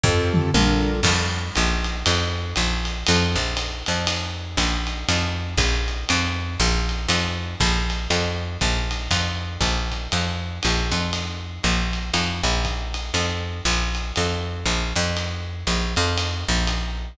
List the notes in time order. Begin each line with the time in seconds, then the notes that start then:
0.03 F2 C4 F4 G4 A4, kick, floor tom
0.34 mid tom
0.54 A#1 D4 F4 A4 A#4, high tom
1.03 F2, kick, crash, ride
1.55 A#1, hi-hat pedal, ride
1.84 ride
2.06 F2, ride
2.56 A#1, hi-hat pedal, ride
2.85 ride
3.07 F2, ride
3.36 A#1
3.57 hi-hat pedal, ride
3.86 F2, ride
4.07 ride
4.57 A#1, kick, hi-hat pedal, ride
4.87 ride
5.09 F2, ride
5.58 A#1, kick, hi-hat pedal, ride
5.88 ride
6.09 F2, ride
6.59 A#1, hi-hat pedal, ride
6.89 ride
7.09 F2, ride
7.60 A#1, kick, hi-hat pedal, ride
7.90 ride
8.10 F2, ride
8.61 A#1, kick, hi-hat pedal, ride
8.91 ride
9.11 F2, kick, ride
9.61 A#1, kick, ride
9.91 kick, hi-hat pedal, ride
10.12 F2, ride
10.63 A#1, hi-hat pedal, ride
10.91 F2, ride
11.13 ride
11.63 A#1, hi-hat pedal, ride
11.93 ride
12.14 F2, ride
12.43 A#1
12.65 kick, hi-hat pedal, ride
12.94 ride
13.14 F2, ride
13.65 A#1, hi-hat pedal, ride
13.95 ride
14.16 F2, ride
14.66 A#1, hi-hat pedal, ride
14.96 F2, ride
15.17 ride
15.67 A#1, hi-hat pedal, ride
15.96 F2, ride
16.18 ride
16.48 A#1
16.67 hi-hat pedal, ride
16.97 hi-hat pedal